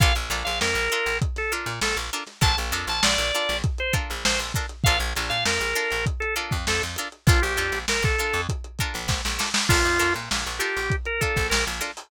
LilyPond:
<<
  \new Staff \with { instrumentName = "Drawbar Organ" } { \time 4/4 \key bes \mixolydian \tempo 4 = 99 f''16 r8 f''16 bes'4 r16 a'16 r8 a'16 r8. | a''16 r8 a''16 d''4 r16 c''16 r8 c''16 r8. | f''16 r8 f''16 bes'4 r16 a'16 r8 a'16 r8. | f'16 g'8. bes'16 a'8. r2 |
f'8. r8. g'8. bes'16 a'8 bes'16 r8. | }
  \new Staff \with { instrumentName = "Pizzicato Strings" } { \time 4/4 \key bes \mixolydian <d' f' a' bes'>8 <d' f' a' bes'>4 <d' f' a' bes'>4 <d' f' a' bes'>4 <d' f' a' bes'>8 | <d' f' a' bes'>8 <d' f' a' bes'>4 <d' f' a' bes'>4 <d' f' a' bes'>4 <d' f' a' bes'>8 | <d' f' a' bes'>8 <d' f' a' bes'>4 <d' f' a' bes'>4 <d' f' a' bes'>4 <d' f' a' bes'>8 | <d' f' a' bes'>8 <d' f' a' bes'>4 <d' f' a' bes'>4 <d' f' a' bes'>4 <d' f' a' bes'>8 |
<d' f' a' bes'>8 <d' f' a' bes'>4 <d' f' a' bes'>4 <d' f' a' bes'>4 <d' f' a' bes'>8 | }
  \new Staff \with { instrumentName = "Electric Bass (finger)" } { \clef bass \time 4/4 \key bes \mixolydian bes,,16 bes,,16 bes,,16 bes,,16 f,16 bes,,8 bes,,4 bes,16 bes,,16 bes,,8. | bes,,16 bes,,16 f,16 bes,,16 bes,,16 bes,,8 bes,,4 bes,,16 bes,,16 bes,,8. | bes,,16 bes,,16 bes,,16 bes,16 f,16 bes,,8 bes,,4 f,16 f,16 f,8. | bes,,16 bes,,16 f,16 bes,,16 bes,,16 bes,,8 f,4 bes,,16 bes,,16 bes,,8. |
bes,,16 f,16 f,16 bes,16 bes,,16 bes,,8 bes,,4 bes,,16 bes,,16 bes,,8. | }
  \new DrumStaff \with { instrumentName = "Drums" } \drummode { \time 4/4 <hh bd>16 hh16 <hh sn>16 hh16 sn16 hh16 hh16 hh16 <hh bd>16 <hh sn>16 hh16 hh16 sn16 hh16 hh16 <hh sn>16 | <hh bd>16 hh16 hh16 hh16 sn16 hh16 hh16 <hh sn>16 <hh bd>16 hh16 <hh bd>16 hh16 sn16 hh16 <hh bd>16 hh16 | <hh bd>16 hh16 hh16 <hh sn>16 sn16 hh16 hh16 hh16 <hh bd>16 hh16 hh16 <hh bd>16 sn16 hh16 hh16 hh16 | <hh bd>16 hh16 hh16 <hh sn>16 sn16 <hh bd>16 hh16 hh16 <hh bd>16 hh16 <hh bd>16 hh16 <bd sn>16 sn16 sn16 sn16 |
<cymc bd>16 hh16 hh16 hh16 sn16 hh16 hh16 hh16 <hh bd>16 hh16 <hh bd>16 <hh bd sn>16 sn16 hh16 <hh sn>16 hho16 | }
>>